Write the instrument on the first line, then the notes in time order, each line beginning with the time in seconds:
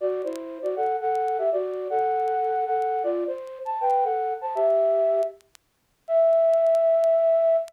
flute
0.00 F#4 D5
0.24 E4 C5
0.62 F#4 D5
0.76 A4 F#5
1.01 A4 F#5
1.38 G4 E5
1.52 F#4 D5
1.90 A4 F#5
2.66 A4 F#5
3.03 F4 D5
3.27 C5
3.65 A5
3.81 B4 G5
4.04 A4 F#5
4.41 C5 A5
4.55 G4 E5
6.08 E5